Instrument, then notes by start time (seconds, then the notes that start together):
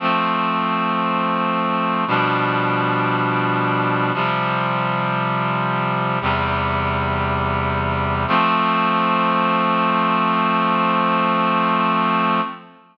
clarinet
0.00 F3 A3 C4
2.07 B2 F3 G3 D4
4.14 C3 F3 G3
6.21 E2 C3 G3
8.28 F3 A3 C4